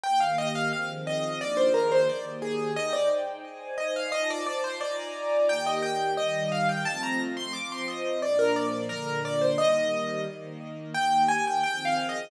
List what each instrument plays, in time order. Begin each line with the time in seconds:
0.04 string ensemble 1 D#3 A#3 G4, acoustic grand piano G5
0.20 acoustic grand piano F5
0.38 acoustic grand piano D#5
0.55 acoustic grand piano F5
0.73 string ensemble 1 D#3 F3 C4 G#4, acoustic grand piano F5
1.07 acoustic grand piano D#5
1.40 string ensemble 1 D#3 F3 A#3 D4 G#4, acoustic grand piano D5
1.57 acoustic grand piano C5
1.74 acoustic grand piano A#4
1.92 acoustic grand piano C5
2.08 string ensemble 1 D#3 A#3 G4, acoustic grand piano D5
2.42 acoustic grand piano G#4
2.76 string ensemble 1 D#4 C5 G5, acoustic grand piano D#5
2.93 acoustic grand piano D5
3.44 string ensemble 1 D#4 C5 G#5
3.78 acoustic grand piano D#5
3.96 acoustic grand piano F5
4.12 string ensemble 1 D#4 F4 C5 A5, acoustic grand piano D#5
4.30 acoustic grand piano D5
4.46 acoustic grand piano D5
4.64 acoustic grand piano C5
4.81 string ensemble 1 D#4 F4 D5 G#5 A#5, acoustic grand piano D5
5.48 string ensemble 1 D#3 A#3 G4, acoustic grand piano G5
5.66 acoustic grand piano D#5
5.83 acoustic grand piano G5
6.17 string ensemble 1 D#3 G3 G4, acoustic grand piano D#5
6.52 acoustic grand piano F5
6.69 acoustic grand piano G5
6.85 string ensemble 1 F3 A3 C4, acoustic grand piano A5
7.03 acoustic grand piano A#5
7.37 acoustic grand piano C6
7.53 string ensemble 1 F3 C4 F4, acoustic grand piano D6
7.72 acoustic grand piano C6
7.88 acoustic grand piano D#5
8.22 string ensemble 1 A#2 F3 D4, acoustic grand piano D5
8.39 acoustic grand piano A#4
8.56 acoustic grand piano D5
8.89 string ensemble 1 A#2 D3 D4, acoustic grand piano A#4
9.25 acoustic grand piano D5
9.41 acoustic grand piano C5
9.58 string ensemble 1 D#3 G3 A#3, acoustic grand piano D#5
10.27 string ensemble 1 D#3 A#3 D#4
10.94 string ensemble 1 D#3 A#3 G4, acoustic grand piano G5
11.28 acoustic grand piano G#5
11.47 acoustic grand piano G5
11.63 string ensemble 1 D#3 F3 C4 G#4, acoustic grand piano G5
11.85 acoustic grand piano F5
12.09 acoustic grand piano D#5